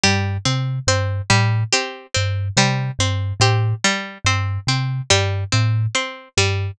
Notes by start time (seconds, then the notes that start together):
0.04 G2 G3 G4
0.45 C3 C4
0.87 G2 C4 C5
1.30 A2 G3
1.73 C4 G4
2.14 G2 C4
2.57 C3 G3 C5
2.99 G2 C4
3.40 A2 C4 G4
3.84 G3
4.25 G2 C4 C5
4.67 C3 C4
5.10 G2 G3 G4
5.52 A2 C4
5.95 C4 C5
6.37 G2 G3